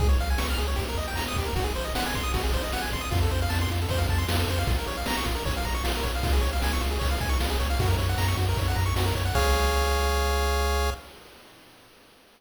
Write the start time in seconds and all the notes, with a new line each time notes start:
0.00 C#2 G#4, kick, ride
0.09 C#5
0.19 C#2 F5, ride
0.30 G#5
0.38 C#2 C#6, snare
0.50 F6
0.58 C#2 G#4, ride
0.68 C#5
0.76 D#2 G4, kick, ride
0.89 A#4
0.97 D#2 D#5, ride
1.08 G5
1.16 D#2 A#5, snare
1.28 D#6
1.36 D#2 G4, kick, ride
1.45 A#4
1.56 G#1 F#4, kick, ride
1.64 G#4
1.75 G#1 C5, ride
1.84 D#5
1.95 G#1 F#5, snare
2.06 G#5
2.14 G#1 C6, kick, ride
2.23 D#6
2.34 G#1 F#4, kick, ride
2.43 G#4
2.52 G#1 C5, kick, ride
2.63 D#5
2.72 G#1 F#5, snare
2.82 G#5
2.91 G#1 C6, kick, ride
3.01 D#6
3.11 F2 F4, kick, ride
3.22 A4
3.31 F2 C5, ride
3.42 F5
3.50 F2 A5, snare
3.61 C6
3.70 F2 F4, ride
3.81 A4
3.89 F2 C5, kick, ride
3.98 F5
4.09 F2 A5, kick, ride
4.18 C6
4.29 F2 F4, snare
4.39 A4
4.48 F2 C5, kick, ride
4.58 F5
4.67 A#1 F4, kick, ride
4.78 A#4
4.87 A#1 C#5, ride
4.97 F5
5.06 A#1 A#5, snare
5.17 C#6
5.25 A#1 F4, kick, ride
5.35 A#4
5.45 A#1 C#5, kick, ride
5.57 F5
5.65 A#1 A#5, kick, ride
5.74 C#6
5.84 A#1 F4, snare
5.96 A#4
6.03 A#1 C#5, kick, ride
6.15 F5
6.23 C#2 F4, kick, ride
6.33 G#4
6.41 C#2 C#5, ride
6.53 F5
6.62 C#2 G#5, snare
6.73 C#6
6.81 C#2 F4, ride
6.91 G#4
6.99 C#2 C#5, kick, ride
7.11 F5
7.20 C#2 G#5, kick, ride
7.29 C#6
7.40 C#2 F4, snare
7.50 G#4
7.60 C#2 C#5, kick, ride
7.70 F5
7.79 F#2 F#4, kick, ride
7.88 A#4
7.98 F#2 C#5, ride
8.09 F#5
8.18 F#2 A#5, snare
8.28 C#6
8.37 F#2 F#4, kick, ride
8.49 A#4
8.57 F#2 C#5, kick, ride
8.68 F#5
8.75 F#2 A#5, kick, ride
8.86 C#6
8.96 F#2 F#4, snare
9.06 A#4
9.15 F#2 C#5, kick, ride
9.25 F#5
9.34 C#2 G#4 C#5 F5, kick, crash